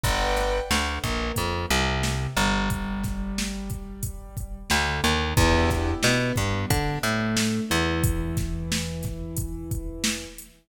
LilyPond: <<
  \new Staff \with { instrumentName = "Acoustic Grand Piano" } { \time 4/4 \key e \minor \tempo 4 = 90 <b' d'' fis'' g''>4 d8 ais8 f8 c4 g8~ | g2. d8 dis8 | <b d' e' g'>4 b8 g8 d'8 a4 e8~ | e1 | }
  \new Staff \with { instrumentName = "Electric Bass (finger)" } { \clef bass \time 4/4 \key e \minor g,,4 d,8 ais,,8 f,8 c,4 g,,8~ | g,,2. d,8 dis,8 | e,4 b,8 g,8 d8 a,4 e,8~ | e,1 | }
  \new DrumStaff \with { instrumentName = "Drums" } \drummode { \time 4/4 <hh bd>8 <hh sn>8 sn8 <hh bd>8 <hh bd>8 hh8 sn8 hh8 | <hh bd>8 <hh bd sn>8 sn8 <hh bd>8 <hh bd>8 <hh bd>8 sn8 hh8 | <hh bd>8 <hh bd sn>8 sn8 <hh bd>8 <hh bd>8 hh8 sn8 hh8 | <hh bd>8 <hh bd sn>8 sn8 <hh bd sn>8 <hh bd>8 <hh bd>8 sn8 hh8 | }
>>